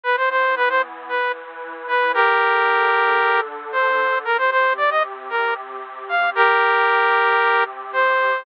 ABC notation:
X:1
M:4/4
L:1/16
Q:1/4=114
K:Bb
V:1 name="Lead 2 (sawtooth)"
=B c c2 B c z2 B2 z4 B2 | [GB]12 c4 | B c c2 d e z2 B2 z4 f2 | [GB]12 c4 |]
V:2 name="Pad 5 (bowed)"
[=E,=B,=E]8 [E,E=B]8 | [D,DA]16 | [C,CG]16 | [C,CG]16 |]